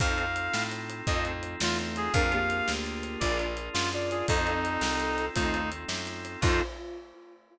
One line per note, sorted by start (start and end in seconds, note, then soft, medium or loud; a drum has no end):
0.00 0.49 F2 medium
0.00 0.25 C4 medium
0.00 2.12 C4 medium
0.00 0.25 D#4 medium
0.00 2.12 D#4 medium
0.00 0.25 F4 medium
0.00 2.12 F4 medium
0.00 0.25 A4 medium
0.00 2.12 A4 medium
0.00 0.63 F5 loud
0.00 kick loud
0.00 closed hi-hat medium
0.18 closed hi-hat medium
0.36 closed hi-hat medium
0.53 1.02 A2 medium
0.53 snare medium
0.71 closed hi-hat medium
0.90 closed hi-hat medium
1.07 1.56 F2 medium
1.07 1.54 A2 medium
1.07 1.54 F3 medium
1.07 1.32 C4 medium
1.07 1.32 D#4 medium
1.07 1.32 F4 medium
1.07 1.32 A4 medium
1.07 1.24 D#5 loud
1.07 kick medium
1.07 closed hi-hat medium
1.25 closed hi-hat medium
1.43 closed hi-hat medium
1.60 2.09 E2 medium
1.60 2.06 A3 medium
1.60 2.06 F4 medium
1.60 1.78 F4 loud
1.60 snare loud
1.79 closed hi-hat medium
1.96 2.13 G#4 loud
1.96 closed hi-hat medium
2.13 2.62 F2 medium
2.13 2.39 D4 medium
2.13 2.31 D4 medium
2.13 4.27 D4 medium
2.13 2.39 F4 medium
2.13 4.27 F4 medium
2.13 2.39 G#4 medium
2.13 4.27 G#4 medium
2.13 2.39 A#4 medium
2.13 2.31 A#4 medium
2.13 4.27 A#4 medium
2.13 2.72 F5 loud
2.13 kick loud
2.13 closed hi-hat medium
2.32 3.18 A#3 medium
2.32 3.18 G4 medium
2.32 closed hi-hat medium
2.50 closed hi-hat medium
2.68 3.17 D2 medium
2.68 snare medium
2.86 closed hi-hat medium
3.03 closed hi-hat medium
3.20 3.69 A#1 medium
3.20 3.46 D4 medium
3.20 3.46 F4 medium
3.20 3.54 F4 medium
3.20 3.46 G#4 medium
3.20 3.46 A#4 medium
3.20 3.37 D5 loud
3.20 3.54 D5 medium
3.20 kick medium
3.20 closed hi-hat loud
3.39 closed hi-hat medium
3.57 closed hi-hat medium
3.73 4.23 F#2 medium
3.73 3.90 F4 loud
3.73 snare loud
3.93 4.09 F4 medium
3.93 4.09 D5 medium
3.93 closed hi-hat medium
4.11 4.27 F4 medium
4.11 4.26 G#4 medium
4.11 4.27 D5 medium
4.11 closed hi-hat medium
4.28 4.78 F2 loud
4.28 6.41 C4 medium
4.28 4.54 C4 medium
4.28 5.26 C4 medium
4.28 6.41 D#4 medium
4.28 4.54 D#4 medium
4.28 5.25 D#4 loud
4.28 6.41 F4 medium
4.28 4.54 F4 medium
4.28 6.41 A4 medium
4.28 4.54 A4 medium
4.28 5.26 A4 medium
4.28 kick loud
4.28 closed hi-hat loud
4.47 closed hi-hat medium
4.65 closed hi-hat medium
4.81 5.29 C2 medium
4.81 snare medium
5.00 closed hi-hat medium
5.18 closed hi-hat medium
5.35 5.85 D#2 medium
5.35 5.68 A3 medium
5.35 5.61 C4 medium
5.35 5.70 D#4 loud
5.35 5.61 D#4 medium
5.35 5.68 F4 medium
5.35 5.61 F4 medium
5.35 5.61 A4 medium
5.35 kick medium
5.35 closed hi-hat loud
5.54 closed hi-hat medium
5.72 closed hi-hat medium
5.88 6.37 F#2 medium
5.88 snare medium
6.07 closed hi-hat medium
6.25 closed hi-hat medium
6.41 6.61 F2 loud
6.41 6.62 C4 loud
6.41 6.62 D#4 loud
6.41 6.62 D#4 medium
6.41 6.60 F4 loud
6.41 6.62 F4 loud
6.41 6.62 A4 loud
6.41 6.62 A4 medium
6.41 kick loud
6.41 crash loud